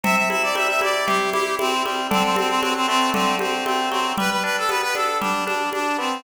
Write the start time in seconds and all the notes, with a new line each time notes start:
0.04 C3 E5, low conga
0.16 E5
0.30 E4 E5, high conga
0.43 D5
0.55 G3 E5, high conga
0.69 E5
0.81 E4 D5, high conga
1.06 C3 G4, low conga
1.32 E4 G4, high conga
1.59 C4 E4, high conga
1.84 G3 C4, high conga
2.11 D3 C4, low conga
2.24 C4
2.36 C4, high conga
2.49 C4
2.61 F#3 C4, high conga
2.75 C4
2.87 A3 C4
3.14 D3 C4, low conga
3.39 C4, high conga
3.65 A3 C4, high conga
3.91 F#3 C4, high conga
4.18 G3 B4, low conga
4.31 B4
4.44 D4 B4
4.58 A4
4.69 B3 B4, high conga
4.82 B4
4.95 D4 A4, high conga
5.21 G3 D4, low conga
5.46 D4, high conga
5.73 D4, high conga
5.98 B3 C4